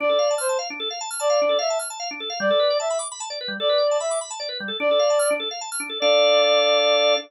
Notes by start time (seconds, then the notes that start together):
0.00 D4 D5
0.09 A4
0.19 F5
0.31 A5
0.38 C5 F6
0.49 A5
0.59 F5
0.70 D4
0.80 A4
0.91 F5
1.01 A5
1.10 F6
1.20 D5 A5
1.30 F5
1.42 D4
1.49 A4
1.59 E5 F5
1.70 A5
1.79 F6
1.90 A5
2.00 F5
2.11 D4
2.20 A4
2.30 F5
2.40 G3 D5
2.51 A4
2.60 B4
2.70 D5
2.80 E5 A5
2.90 B5
2.99 D6
3.12 B5
3.20 A5
3.30 D5
3.41 B4
3.48 G3
3.60 A4 D5
3.69 B4
3.78 D5
3.91 A5
4.00 E5 B5
4.11 D6
4.21 B5
4.31 A5
4.40 D5
4.49 B4
4.60 G3
4.68 A4
4.80 D4 D5
4.91 A4
4.99 F5
5.10 A5
5.19 F6
5.31 D4
5.40 A4
5.51 F5
5.61 A5
5.72 F6
5.80 D4
5.90 A4
6.00 D4 A4 D5 F5